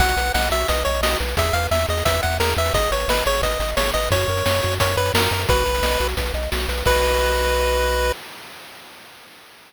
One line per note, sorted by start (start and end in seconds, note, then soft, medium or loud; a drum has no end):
0.00 0.15 B1 medium
0.00 0.15 F#4 medium
0.00 0.32 F#5 medium
0.00 kick loud
0.00 closed hi-hat loud
0.08 closed hi-hat medium
0.17 0.31 B1 medium
0.17 0.32 B4 medium
0.17 closed hi-hat medium
0.26 closed hi-hat medium
0.34 0.49 B1 medium
0.34 0.50 D#5 medium
0.34 0.49 F#5 medium
0.34 snare loud
0.43 closed hi-hat medium
0.50 0.65 B1 medium
0.50 0.67 F#4 medium
0.50 0.68 E5 medium
0.50 closed hi-hat medium
0.60 closed hi-hat medium
0.68 0.84 B1 medium
0.68 0.84 B4 medium
0.68 0.83 D#5 medium
0.68 kick medium
0.68 closed hi-hat loud
0.77 closed hi-hat medium
0.85 1.01 B1 medium
0.85 1.01 C#5 medium
0.85 1.01 D#5 medium
0.85 closed hi-hat medium
0.94 closed hi-hat medium
1.01 1.16 B1 medium
1.01 1.18 F#4 medium
1.01 1.17 D#5 medium
1.01 snare loud
1.11 closed hi-hat medium
1.20 1.35 B1 medium
1.20 1.35 B4 medium
1.20 closed hi-hat medium
1.28 closed hi-hat medium
1.37 1.52 E2 medium
1.37 1.53 G#4 medium
1.37 1.55 E5 medium
1.37 kick loud
1.37 closed hi-hat loud
1.45 closed hi-hat medium
1.53 1.68 E2 medium
1.53 1.70 B4 medium
1.53 1.67 F5 medium
1.53 closed hi-hat medium
1.63 closed hi-hat medium
1.71 1.86 E2 medium
1.71 1.86 E5 medium
1.71 1.87 E5 medium
1.71 snare loud
1.80 closed hi-hat medium
1.88 2.03 E2 medium
1.88 2.04 G#4 medium
1.88 2.04 D#5 medium
1.88 closed hi-hat medium
1.97 closed hi-hat medium
2.05 2.20 E2 medium
2.05 2.21 B4 medium
2.05 2.21 E5 medium
2.05 kick loud
2.05 closed hi-hat loud
2.14 closed hi-hat medium
2.23 2.39 E2 medium
2.23 2.38 E5 medium
2.23 2.37 F#5 medium
2.23 closed hi-hat medium
2.32 closed hi-hat medium
2.40 2.54 E2 medium
2.40 2.55 G#4 medium
2.40 2.54 A#4 medium
2.40 snare loud
2.49 closed hi-hat medium
2.57 2.71 E2 medium
2.57 2.73 B4 medium
2.57 2.73 E5 medium
2.57 closed hi-hat medium
2.66 closed hi-hat medium
2.74 2.88 G#1 medium
2.74 2.90 G#4 loud
2.74 2.91 D#5 medium
2.74 kick loud
2.74 closed hi-hat loud
2.83 closed hi-hat medium
2.91 3.06 G#1 medium
2.91 3.07 B4 medium
2.91 3.09 C#5 medium
2.91 closed hi-hat medium
3.00 closed hi-hat medium
3.08 3.23 G#1 medium
3.08 3.24 B4 medium
3.08 3.24 D#5 medium
3.08 snare loud
3.17 closed hi-hat medium
3.26 3.41 G#1 medium
3.26 3.41 G#4 medium
3.26 3.41 C#5 medium
3.26 closed hi-hat medium
3.35 closed hi-hat medium
3.42 3.57 G#1 medium
3.42 3.58 B4 medium
3.42 3.71 D#5 medium
3.42 kick medium
3.42 closed hi-hat loud
3.51 closed hi-hat medium
3.60 3.74 G#1 medium
3.60 3.75 D#5 medium
3.60 closed hi-hat medium
3.69 closed hi-hat medium
3.77 3.92 G#1 medium
3.77 3.93 G#4 medium
3.77 3.91 C#5 medium
3.77 snare loud
3.86 closed hi-hat medium
3.94 4.09 G#1 medium
3.94 4.10 B4 medium
3.94 4.09 D#5 medium
3.94 closed hi-hat medium
4.03 closed hi-hat medium
4.11 4.25 F#2 medium
4.11 4.27 F#4 loud
4.11 4.75 C#5 medium
4.11 kick loud
4.11 closed hi-hat loud
4.20 closed hi-hat medium
4.28 4.43 F#2 medium
4.28 4.44 A#4 medium
4.28 closed hi-hat medium
4.37 closed hi-hat medium
4.46 4.61 F#2 medium
4.46 4.61 C#5 medium
4.46 snare loud
4.54 closed hi-hat medium
4.63 4.79 F#2 medium
4.63 4.78 F#4 medium
4.63 closed hi-hat medium
4.72 closed hi-hat medium
4.80 4.96 F#2 medium
4.80 4.95 A#4 medium
4.80 4.96 C#5 medium
4.80 kick loud
4.80 closed hi-hat loud
4.89 closed hi-hat medium
4.97 5.11 F#2 medium
4.97 5.12 B4 medium
4.97 5.13 C#5 medium
4.97 closed hi-hat medium
5.06 closed hi-hat medium
5.14 5.28 F#2 medium
5.14 5.30 F#4 medium
5.14 5.43 A#4 medium
5.14 snare loud
5.22 closed hi-hat medium
5.31 5.46 F#2 medium
5.31 5.47 A#4 medium
5.31 closed hi-hat medium
5.40 closed hi-hat medium
5.48 5.64 B1 medium
5.48 5.64 F#4 loud
5.48 6.07 B4 medium
5.48 kick loud
5.48 closed hi-hat loud
5.57 closed hi-hat medium
5.66 5.81 B1 medium
5.66 5.81 B4 medium
5.66 closed hi-hat medium
5.75 closed hi-hat medium
5.82 5.97 B1 medium
5.82 5.98 D#5 medium
5.82 snare loud
5.92 closed hi-hat medium
6.00 6.15 B1 medium
6.00 6.15 F#4 medium
6.00 closed hi-hat medium
6.08 closed hi-hat medium
6.17 6.32 B1 medium
6.17 6.33 B4 medium
6.17 kick medium
6.17 closed hi-hat loud
6.26 closed hi-hat medium
6.34 6.48 B1 medium
6.34 6.50 D#5 medium
6.34 closed hi-hat medium
6.43 closed hi-hat medium
6.51 6.67 B1 medium
6.51 6.67 F#4 medium
6.51 snare loud
6.60 closed hi-hat medium
6.68 6.83 B1 medium
6.68 6.84 B4 medium
6.68 closed hi-hat medium
6.78 closed hi-hat medium
6.86 8.12 B1 loud
6.86 8.12 F#4 medium
6.86 8.12 B4 loud
6.86 8.12 D#5 loud
6.86 kick loud
6.86 crash loud